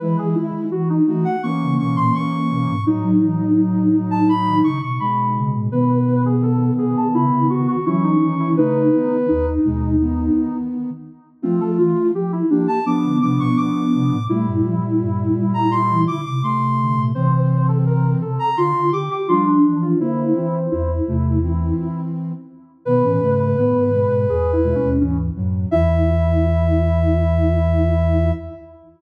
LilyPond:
<<
  \new Staff \with { instrumentName = "Ocarina" } { \time 4/4 \key e \major \tempo 4 = 84 r4. r16 fis''16 cis'''8 cis'''16 bis''16 cis'''4 | r4. r16 a''16 b''8 cis'''16 cis'''16 b''4 | r4. r16 a''16 b''8 cis'''16 cis'''16 cis'''4 | b'4. r2 r8 |
\key f \major r4. r16 a''16 d'''8 d'''16 des'''16 d'''4 | r4. r16 bes''16 c'''8 d'''16 d'''16 c'''4 | r4. r16 bes''16 c'''8 d'''16 d'''16 c'''4 | c''4. r2 r8 |
\key e \major b'2. r4 | e''1 | }
  \new Staff \with { instrumentName = "Ocarina" } { \time 4/4 \key e \major b'16 gis'16 e'8 fis'16 dis'16 dis'16 r16 ais2 | dis'2. r4 | b'8. gis'16 a'8 gis'8 e'8 fis'16 fis'16 e'16 dis'8 e'16 | dis'4 dis'2 r4 |
\key f \major c'16 a'16 f'8 g'16 e'16 d'16 r16 b2 | e'2. r4 | c''8. a'16 bes'8 a'8 f'8 g'16 g'16 f'16 d'8 f'16 | e'4 e'2 r4 |
\key e \major b'8. b'16 b'4 \tuplet 3/2 { gis'8 e'8 cis'8 } cis'16 r8. | e'1 | }
  \new Staff \with { instrumentName = "Ocarina" } { \time 4/4 \key e \major <gis e'>4 r8 <a fis'>8 <e cis'>8 <e cis'>4. | <a, fis>2. <b, gis>4 | <dis b>2. <e cis'>4 | <cis a>8 <dis b>8 r8 <b, gis>8 <dis b>4. r8 |
\key f \major <a f'>4 r8 <bes g'>8 <f d'>8 <f d'>4. | <bes, g>2. <c a>4 | <e c'>4. r4. <f d'>4 | <d bes>8 <e c'>8 r8 <c a>8 <e c'>4. r8 |
\key e \major <dis b>16 <e cis'>16 <cis a>8 <dis b>8 <b, gis>8 r8 <b, gis>16 <b, gis>16 <gis, e>8 <a, fis>8 | e1 | }
  \new Staff \with { instrumentName = "Ocarina" } { \time 4/4 \key e \major e16 e16 dis16 r16 e8 e16 r8 cis16 b,16 ais,16 r8 b,16 gis,16 | fis16 fis16 e16 r16 fis8 fis16 r8 dis16 cis16 b,16 r8 cis16 a,16 | b,4. b,16 r16 cis16 cis16 cis16 r16 fis8 dis8 | r4 dis,8 dis,4 r4. |
\key f \major f16 f16 e16 r16 f8 f16 r8 d16 c16 b,16 r8 c16 a,16 | a16 g,16 f16 r16 g,8 g16 r8 e16 d16 c16 r8 d16 bes,16 | c4. c16 r16 d16 d16 d16 r16 g8 e8 | r4 e,8 e,4 r4. |
\key e \major b,16 a,16 gis,8 a,16 gis,8 gis,16 e,8. dis,8. fis,8 | e,1 | }
>>